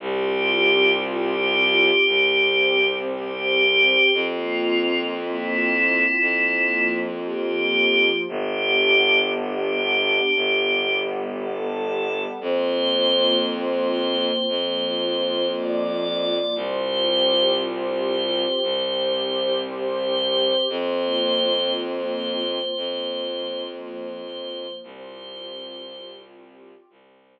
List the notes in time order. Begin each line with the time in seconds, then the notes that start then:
0.00 C2 C4 F4 G4
1.04 G4
2.06 C2 C4 G4 C5
3.12 G4
4.13 F2 A#3 C4 F4
5.18 E4
6.20 F2 F3 A#3 F4
7.23 G4
8.26 G1 B3 D4 G4
9.30 G4
10.34 G1 G3 B3 G4
11.39 A4
12.41 F2 A#3 C4 F4 C5
13.46 C5
14.48 F2 F3 A#3 F4
15.53 D5
16.55 C2 C4 F4 G4 C5
17.59 C5
18.62 C2 C4 G4 C5
19.65 C5
20.69 F2 A#3 C4 F4 C5
21.73 C5
22.76 F2 F3 A#3 F4
23.79 C5
24.82 C2 C4 F4 G4 C5
26.90 C2 C4 G4 C5